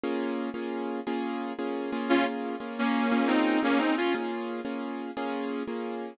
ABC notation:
X:1
M:12/8
L:1/8
Q:3/8=117
K:Bbm
V:1 name="Distortion Guitar"
z12 | [DF] z3 [B,D]3 [CE]2 [B,D] [CE] [DF] | z12 |]
V:2 name="Acoustic Grand Piano"
[B,DFA]3 [B,DFA]3 [B,DFA]3 [B,DFA]2 [B,DFA]- | [B,DFA]3 [B,DFA]3 [B,DFA]3 [B,DFA]3 | [B,DFA]3 [B,DFA]3 [B,DFA]3 [B,DFA]3 |]